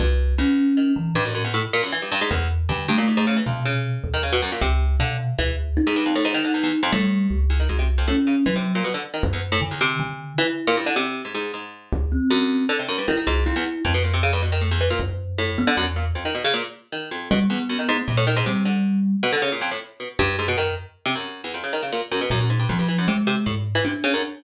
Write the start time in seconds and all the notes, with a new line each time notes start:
0.00 C2 G2
0.38 E2 C#4
0.77 D#3
0.96 E3
1.15 G2 A2
1.25 F#2
1.35 F#2
1.44 E2
1.54 A2
1.73 A#2
1.83 F#2
1.92 E3
2.02 G2
2.12 G2
2.21 G#2
2.31 E2
2.69 G2 D3
2.88 G2 A3
2.98 A#2
3.08 G#2
3.17 G#2
3.27 C#3
3.37 E3
3.46 F2 B2
3.65 C#3
4.04 D#2
4.14 D#3
4.23 C#3
4.33 B2
4.42 F#2
4.52 A#2
4.61 C#2 C3
5.00 B2 D3
5.39 D2 E3
5.77 D#4
5.87 G#2
5.96 G2
6.06 F2
6.15 A2
6.25 G#2
6.34 D#3
6.44 D3
6.54 E2
6.63 E2
6.83 F2
6.92 A2 G3
7.30 C#2
7.50 E2
7.60 D#3
7.69 C2 G#2
7.79 C3
7.98 F2
8.08 A2 C#4
8.27 C#3
8.46 E3 F#3
8.56 C3
8.75 A#2
8.84 B2
8.94 D3
9.14 D#3
9.23 F#2
9.33 E2
9.52 A2
9.61 D3
9.71 E2
9.81 C3
10.00 D3
10.38 E3 E4
10.67 A#2
10.77 G2
10.86 D3
10.96 C3
11.25 G#2
11.35 G#2
11.54 G#2
11.93 D2
12.12 C4
12.31 F#2
12.69 D3
12.79 C3
12.88 F#2
12.98 G2
13.08 D#3 E4
13.17 D#3
13.27 C2 G#2
13.46 F2 E4
13.56 E2
13.85 F2
13.94 B2
14.04 A#2
14.14 C3
14.23 C#3
14.33 G2
14.42 B2
14.52 D#3
14.61 A2
14.71 E2
14.81 E3
14.90 A#2
15.00 F#2
15.38 A2
15.58 B3
15.67 D3
15.77 E2 F#2
15.96 A#2
16.15 F2
16.25 D#3
16.35 B2
16.44 C#3
16.54 A#2
16.92 D#3
17.11 F2
17.31 B2 G3
17.50 E2 B3
17.69 F#2
17.79 D#3
17.89 G#2
18.08 G2 A#2
18.17 A2
18.27 D#3
18.36 G#2
18.46 C3 G3
18.65 D3
19.23 B2
19.33 D3
19.42 C#3
19.52 A#2
19.61 F2
19.71 A2
20.00 B2
20.19 F#2 G2
20.39 G#2
20.48 B2
20.58 D#3
21.06 C3
21.15 F#2
21.44 E2
21.54 F2
21.64 C#3
21.73 D#3
21.83 C#3
21.92 A#2
22.12 F#2
22.21 B2
22.30 F#2 A#2
22.41 F#2
22.50 G#2
22.59 G2
22.69 F2 F3
22.79 G2
22.89 E3
22.98 F#2
23.08 C3 G#3
23.27 C3
23.46 G#2 A2
23.75 E3
23.84 C3 D4
24.04 C#3
24.14 F#2